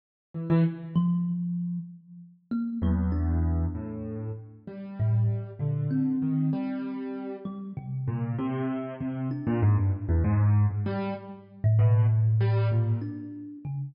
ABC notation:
X:1
M:9/8
L:1/16
Q:3/8=65
K:none
V:1 name="Acoustic Grand Piano" clef=bass
z2 E, E, z14 | E,,6 A,,4 z2 G,6 | D,4 ^D,2 G,6 z4 ^A,,2 | C,4 C,2 z ^A,, ^G,, =G,, z E,, ^G,,3 G,, =G,2 |
z4 B,,2 z2 G,2 ^A,,2 z6 |]
V:2 name="Kalimba"
z6 F,6 z4 ^A,2 | ^F,2 D8 z4 A,,2 z2 | ^A,,2 C10 G,2 C,4 | z6 D6 z6 |
z3 A,, A,,8 D4 ^C,2 |]